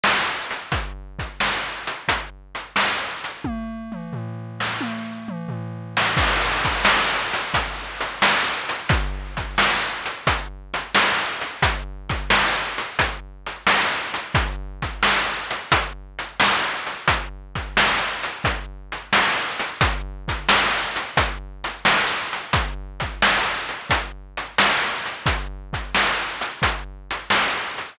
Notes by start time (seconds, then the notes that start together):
0.04 snare
0.51 closed hi-hat
0.72 kick, closed hi-hat
1.19 kick, closed hi-hat
1.40 snare
1.87 closed hi-hat
2.08 kick, closed hi-hat
2.55 closed hi-hat
2.76 snare
3.24 closed hi-hat
3.44 kick, high tom
3.92 mid tom
4.13 floor tom
4.60 snare
4.81 high tom
5.28 mid tom
5.48 floor tom
5.97 snare
6.17 kick, crash
6.65 kick, closed hi-hat
6.85 snare
7.33 closed hi-hat
7.54 kick, closed hi-hat
8.01 snare, closed hi-hat
8.22 snare
8.69 closed hi-hat
8.89 kick, closed hi-hat
9.37 kick, closed hi-hat
9.58 snare
10.06 closed hi-hat
10.27 kick, closed hi-hat
10.74 closed hi-hat
10.95 snare
11.41 closed hi-hat
11.62 kick, closed hi-hat
12.10 kick, closed hi-hat
12.30 snare
12.78 closed hi-hat
12.99 kick, closed hi-hat
13.46 closed hi-hat
13.67 snare
14.14 closed hi-hat
14.35 kick, closed hi-hat
14.82 kick, closed hi-hat
15.03 snare
15.51 closed hi-hat
15.72 kick, closed hi-hat
16.19 closed hi-hat
16.40 snare
16.87 closed hi-hat
17.08 kick, closed hi-hat
17.55 kick, closed hi-hat
17.77 snare
18.23 closed hi-hat
18.44 kick, closed hi-hat
18.92 closed hi-hat
19.13 snare
19.60 closed hi-hat
19.81 kick, closed hi-hat
20.28 kick, closed hi-hat
20.49 snare
20.96 closed hi-hat
21.17 kick, closed hi-hat
21.64 closed hi-hat
21.85 snare
22.33 closed hi-hat
22.53 kick, closed hi-hat
23.00 kick, closed hi-hat
23.22 snare
23.69 closed hi-hat
23.90 kick, closed hi-hat
24.37 closed hi-hat
24.58 snare
25.06 closed hi-hat
25.26 kick, closed hi-hat
25.73 kick, closed hi-hat
25.95 snare
26.41 closed hi-hat
26.62 kick, closed hi-hat
27.11 closed hi-hat
27.30 snare
27.78 closed hi-hat